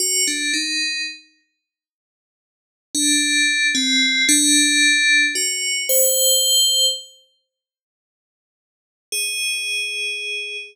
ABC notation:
X:1
M:5/4
L:1/16
Q:1/4=56
K:none
V:1 name="Tubular Bells"
_G D _E2 z7 D3 C2 D4 | _G2 c4 z8 _A6 |]